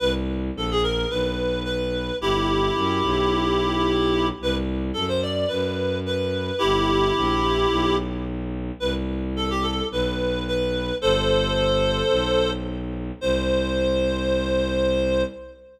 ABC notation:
X:1
M:4/4
L:1/16
Q:1/4=109
K:Clyd
V:1 name="Clarinet"
B z3 A ^G ^A2 B4 B4 | [EG]16 | B z3 A c d2 B4 B4 | [EG]12 z4 |
B z3 A G A2 B4 B4 | [Ac]12 z4 | c16 |]
V:2 name="Violin" clef=bass
C,,4 ^A,,,4 B,,,8 | G,,,4 F,,2 B,,,10 | C,,4 F,,4 F,,8 | G,,,4 ^A,,,4 B,,,8 |
C,,8 B,,,8 | G,,,8 B,,,8 | C,,16 |]